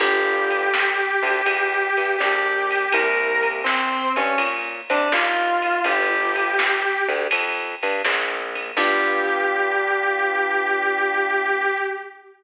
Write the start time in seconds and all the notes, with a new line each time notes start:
0.00 G1 B3 D4 F4 G4, kick, crash
0.51 ride
0.74 snare
1.23 D2 D3, kick, ride
1.46 E2 F3, kick, ride
1.97 G2 G3, ride
2.18 A#1 A#3 G4, snare
2.71 ride
2.92 C2 A#3 C4 E4 G4 A#4, kick, ride
3.43 kick, ride
3.64 C4, snare
4.16 G2 G3 C#4, kick, ride
4.38 A#2 A#3, kick, ride
4.90 C3 C4 D4, ride
5.12 D#2 D#3 F4, snare
5.62 kick, ride
5.84 G1 B3 D4 F4 G4, kick, ride
6.36 ride
6.59 snare
7.08 D2 D3, kick, ride
7.31 F2 F3, kick, ride
7.83 G2 G3, ride
8.04 A#1 A#3, snare
8.55 kick, ride
8.77 G2 B3 D4 F4 G4, kick, crash